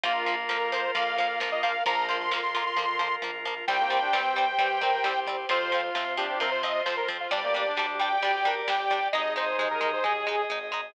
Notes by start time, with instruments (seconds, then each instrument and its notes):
0.04 synth bass 1 A#1, acoustic guitar (steel) F3 A#3, brass section A#3, pad 2 (warm) F4 A#4, drawbar organ F4 A#4, lead 2 (sawtooth) F4, kick, ride
0.26 acoustic guitar (steel) F3 A#3, ride
0.49 synth bass 1 F2, acoustic guitar (steel) F3 A#3, lead 2 (sawtooth) A#4, snare
0.72 acoustic guitar (steel) F3 A#3, lead 2 (sawtooth) C5, ride
0.94 synth bass 1 F2, acoustic guitar (steel) F3 A#3, brass section A#3, lead 2 (sawtooth) F5, kick, ride
1.18 acoustic guitar (steel) F3 A#3, lead 2 (sawtooth) F5, kick, ride
1.40 synth bass 1 A#1, acoustic guitar (steel) F3 A#3, snare
1.52 lead 2 (sawtooth) D#5
1.63 acoustic guitar (steel) F3 A#3, lead 2 (sawtooth) F5, kick, ride
1.86 synth bass 1 A#1, acoustic guitar (steel) F3 A#3, brass section F3, pad 2 (warm) F4 A#4, drawbar organ F4 A#4, lead 2 (sawtooth) A#5, kick, ride
2.09 acoustic guitar (steel) F3 A#3, lead 2 (sawtooth) C6, ride
2.20 lead 2 (sawtooth) C6
2.31 synth bass 1 F2, acoustic guitar (steel) F3 A#3, snare
2.43 lead 2 (sawtooth) C6
2.54 acoustic guitar (steel) F3 A#3, lead 2 (sawtooth) C6, kick, ride
2.66 lead 2 (sawtooth) C6
2.77 synth bass 1 F2, acoustic guitar (steel) F3 A#3, kick, high tom
2.99 acoustic guitar (steel) F3 A#3, floor tom
3.22 synth bass 1 A#1, acoustic guitar (steel) F3 A#3, high tom
3.45 acoustic guitar (steel) F3 A#3, floor tom
3.68 synth bass 1 C2, acoustic guitar (steel) G3 C4, brass section G3, drawbar organ G4 C5, pad 2 (warm) G4 C5, lead 2 (sawtooth) G5, kick, crash
3.78 brass section A#3
3.90 acoustic guitar (steel) G3 C4, ride
4.01 brass section D4
4.13 synth bass 1 G2, acoustic guitar (steel) G3 C4, brass section C4, snare
4.36 acoustic guitar (steel) G3 C4, ride
4.58 synth bass 1 G2, acoustic guitar (steel) G3 C4, brass section G4, kick, ride
4.81 acoustic guitar (steel) G3 C4, brass section A#4, kick, ride
5.04 synth bass 1 C2, acoustic guitar (steel) G3 C4, brass section G4, snare
5.27 acoustic guitar (steel) G3 C4, kick, ride
5.49 synth bass 1 F2, acoustic guitar (steel) F3 C4, pad 2 (warm) F4 C5, drawbar organ F4 C5, brass section F4, lead 2 (sawtooth) C5, kick, ride
5.72 acoustic guitar (steel) F3 C4, brass section F4, ride
5.95 synth bass 1 C3, acoustic guitar (steel) F3 C4, snare
6.17 acoustic guitar (steel) F3 C4, brass section D4, lead 2 (sawtooth) G4, kick, ride
6.40 synth bass 1 C3, acoustic guitar (steel) F3 C4, lead 2 (sawtooth) A#4, kick, ride
6.51 lead 2 (sawtooth) C5
6.63 acoustic guitar (steel) F3 C4, lead 2 (sawtooth) D#5, kick, ride
6.86 synth bass 1 F2, acoustic guitar (steel) F3 C4, lead 2 (sawtooth) C5, snare
6.97 lead 2 (sawtooth) A#4
7.08 acoustic guitar (steel) F3 C4, kick, ride
7.20 lead 2 (sawtooth) F4
7.31 synth bass 1 G1, acoustic guitar (steel) G3 D4, brass section G3, drawbar organ G4 D5, pad 2 (warm) G4 D5, lead 2 (sawtooth) D5, kick, ride
7.43 brass section A#3
7.54 acoustic guitar (steel) G3 D4, ride
7.67 brass section D4
7.77 synth bass 1 D2, acoustic guitar (steel) G3 D4, brass section D4, snare
8.00 acoustic guitar (steel) G3 D4, lead 2 (sawtooth) G5, ride
8.22 synth bass 1 D2, acoustic guitar (steel) G3 D4, brass section G4, kick, ride
8.45 acoustic guitar (steel) G3 D4, brass section A#4, kick, ride
8.67 synth bass 1 G1, acoustic guitar (steel) G3 D4, brass section G4, lead 2 (sawtooth) G5, snare
8.90 acoustic guitar (steel) G3 D4, kick, ride
9.12 synth bass 1 G#1, acoustic guitar (steel) G#3 D#4, brass section D#4, drawbar organ G#4 D#5, pad 2 (warm) G#4 D#5, lead 2 (sawtooth) D#5, kick, snare
9.36 acoustic guitar (steel) G#3 D#4, lead 2 (sawtooth) C5, snare
9.58 synth bass 1 D#2, acoustic guitar (steel) G#3 D#4, lead 2 (sawtooth) C5, high tom
9.71 lead 2 (sawtooth) A#4
9.81 acoustic guitar (steel) G#3 D#4, brass section D#4, high tom
9.93 lead 2 (sawtooth) C5
10.04 synth bass 1 D#2, acoustic guitar (steel) G#3 D#4, brass section G#4, lead 2 (sawtooth) G#4, mid tom
10.27 acoustic guitar (steel) G#3 D#4, mid tom
10.50 synth bass 1 G#1, acoustic guitar (steel) G#3 D#4, floor tom
10.72 acoustic guitar (steel) G#3 D#4, floor tom